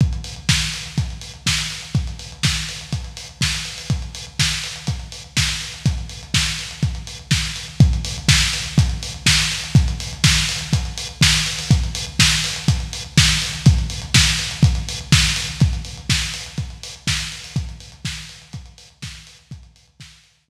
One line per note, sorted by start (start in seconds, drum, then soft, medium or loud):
0.01 kick loud
0.01 closed hi-hat medium
0.13 closed hi-hat medium
0.24 open hi-hat medium
0.36 closed hi-hat medium
0.49 kick loud
0.49 snare loud
0.61 closed hi-hat medium
0.74 open hi-hat medium
0.86 closed hi-hat medium
0.98 kick loud
0.98 closed hi-hat loud
1.10 closed hi-hat medium
1.21 open hi-hat medium
1.34 closed hi-hat medium
1.46 kick medium
1.46 snare loud
1.58 closed hi-hat medium
1.70 open hi-hat medium
1.82 closed hi-hat medium
1.95 kick loud
1.95 closed hi-hat medium
2.07 closed hi-hat medium
2.19 open hi-hat medium
2.32 closed hi-hat medium
2.43 kick medium
2.43 snare loud
2.56 closed hi-hat medium
2.69 open hi-hat medium
2.81 closed hi-hat medium
2.92 kick medium
2.92 closed hi-hat loud
3.04 closed hi-hat medium
3.17 open hi-hat medium
3.29 closed hi-hat medium
3.41 kick medium
3.41 snare loud
3.54 closed hi-hat medium
3.65 open hi-hat medium
3.78 open hi-hat medium
3.90 kick loud
3.90 closed hi-hat loud
4.02 closed hi-hat medium
4.15 open hi-hat medium
4.27 closed hi-hat medium
4.39 kick medium
4.39 snare loud
4.52 closed hi-hat medium
4.64 open hi-hat medium
4.76 closed hi-hat medium
4.87 kick medium
4.87 closed hi-hat loud
4.99 closed hi-hat medium
5.12 open hi-hat medium
5.24 closed hi-hat medium
5.37 kick medium
5.37 snare loud
5.49 closed hi-hat medium
5.61 open hi-hat medium
5.74 closed hi-hat medium
5.86 kick loud
5.86 closed hi-hat loud
5.98 closed hi-hat medium
6.09 open hi-hat medium
6.23 closed hi-hat medium
6.34 kick medium
6.34 snare loud
6.46 closed hi-hat medium
6.59 open hi-hat medium
6.71 closed hi-hat medium
6.83 kick loud
6.83 closed hi-hat loud
6.95 closed hi-hat medium
7.07 open hi-hat medium
7.19 closed hi-hat medium
7.31 kick loud
7.31 snare loud
7.45 closed hi-hat medium
7.56 open hi-hat medium
7.68 closed hi-hat medium
7.80 kick loud
7.80 closed hi-hat loud
7.93 closed hi-hat medium
8.05 open hi-hat loud
8.18 closed hi-hat loud
8.28 kick loud
8.28 snare loud
8.42 closed hi-hat medium
8.53 open hi-hat loud
8.66 closed hi-hat medium
8.78 kick loud
8.78 closed hi-hat loud
8.90 closed hi-hat medium
9.03 open hi-hat loud
9.14 closed hi-hat medium
9.26 kick loud
9.26 snare loud
9.39 closed hi-hat loud
9.52 open hi-hat medium
9.64 closed hi-hat medium
9.75 kick loud
9.75 closed hi-hat loud
9.88 closed hi-hat loud
10.00 open hi-hat loud
10.13 closed hi-hat medium
10.24 kick loud
10.24 snare loud
10.36 closed hi-hat medium
10.49 open hi-hat loud
10.61 closed hi-hat loud
10.73 kick loud
10.73 closed hi-hat loud
10.85 closed hi-hat medium
10.98 open hi-hat loud
11.09 closed hi-hat medium
11.21 kick loud
11.21 snare loud
11.34 closed hi-hat loud
11.46 open hi-hat loud
11.59 open hi-hat loud
11.71 kick loud
11.71 closed hi-hat loud
11.84 closed hi-hat medium
11.95 open hi-hat loud
12.07 closed hi-hat medium
12.19 kick loud
12.19 snare loud
12.32 closed hi-hat medium
12.44 open hi-hat loud
12.56 closed hi-hat loud
12.68 kick loud
12.68 closed hi-hat loud
12.80 closed hi-hat medium
12.93 open hi-hat loud
13.04 closed hi-hat medium
13.17 kick loud
13.17 snare loud
13.29 closed hi-hat medium
13.42 open hi-hat loud
13.53 closed hi-hat medium
13.66 kick loud
13.66 closed hi-hat loud
13.78 closed hi-hat medium
13.90 open hi-hat loud
14.02 closed hi-hat loud
14.14 kick loud
14.14 snare loud
14.27 closed hi-hat medium
14.39 open hi-hat loud
14.51 closed hi-hat loud
14.63 kick loud
14.63 closed hi-hat loud
14.75 closed hi-hat loud
14.89 open hi-hat loud
15.01 closed hi-hat medium
15.12 kick loud
15.12 snare loud
15.24 closed hi-hat medium
15.36 open hi-hat loud
15.49 closed hi-hat medium
15.60 kick loud
15.60 closed hi-hat loud
15.73 closed hi-hat medium
15.85 open hi-hat medium
15.97 closed hi-hat medium
16.09 kick loud
16.09 snare loud
16.22 closed hi-hat medium
16.34 open hi-hat loud
16.46 closed hi-hat medium
16.58 kick medium
16.58 closed hi-hat loud
16.70 closed hi-hat medium
16.83 open hi-hat loud
16.96 closed hi-hat medium
17.07 kick loud
17.07 snare loud
17.20 closed hi-hat medium
17.32 open hi-hat medium
17.44 open hi-hat medium
17.56 kick loud
17.56 closed hi-hat loud
17.69 closed hi-hat medium
17.80 open hi-hat medium
17.92 closed hi-hat medium
18.05 kick loud
18.05 snare loud
18.17 closed hi-hat medium
18.29 open hi-hat medium
18.42 closed hi-hat medium
18.53 kick loud
18.53 closed hi-hat loud
18.66 closed hi-hat medium
18.78 open hi-hat loud
18.90 closed hi-hat medium
19.02 kick loud
19.02 snare loud
19.15 closed hi-hat medium
19.27 open hi-hat loud
19.39 closed hi-hat medium
19.51 kick loud
19.51 closed hi-hat loud
19.63 closed hi-hat medium
19.76 open hi-hat medium
19.88 closed hi-hat medium
20.00 kick loud
20.00 snare loud
20.12 closed hi-hat medium
20.24 open hi-hat medium
20.37 closed hi-hat medium
20.48 kick loud